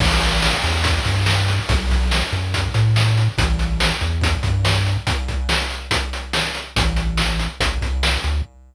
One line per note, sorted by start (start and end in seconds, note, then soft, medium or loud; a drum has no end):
0.00 0.54 A1 loud
0.00 kick loud
0.00 crash loud
0.21 closed hi-hat medium
0.42 snare loud
0.64 0.99 E2 medium
0.64 closed hi-hat medium
0.84 kick loud
0.84 closed hi-hat loud
1.05 1.59 G2 medium
1.05 kick medium
1.05 closed hi-hat medium
1.26 snare loud
1.48 closed hi-hat medium
1.69 2.23 B1 loud
1.69 kick loud
1.69 closed hi-hat loud
1.90 kick medium
1.90 closed hi-hat medium
2.11 snare loud
2.32 2.68 F#2 medium
2.32 closed hi-hat medium
2.54 kick medium
2.54 closed hi-hat loud
2.74 3.29 A2 medium
2.74 closed hi-hat medium
2.96 snare loud
3.17 closed hi-hat medium
3.38 3.92 A1 loud
3.38 kick loud
3.38 closed hi-hat loud
3.59 closed hi-hat medium
3.80 snare loud
4.01 4.37 E2 medium
4.01 closed hi-hat medium
4.21 kick loud
4.21 closed hi-hat loud
4.43 4.97 G2 medium
4.43 kick loud
4.43 closed hi-hat medium
4.65 snare loud
4.87 closed hi-hat medium
5.07 kick loud
5.07 closed hi-hat loud
5.28 kick medium
5.28 closed hi-hat medium
5.49 snare loud
5.70 closed hi-hat medium
5.91 kick loud
5.91 closed hi-hat loud
6.13 closed hi-hat medium
6.33 snare loud
6.54 closed hi-hat medium
6.76 7.48 A1 loud
6.76 kick loud
6.76 closed hi-hat loud
6.96 closed hi-hat medium
7.17 snare loud
7.39 closed hi-hat medium
7.60 7.78 A1 medium
7.60 kick loud
7.60 closed hi-hat loud
7.81 8.18 C2 medium
7.81 kick medium
7.81 closed hi-hat medium
8.03 snare loud
8.24 8.42 D2 medium
8.24 closed hi-hat medium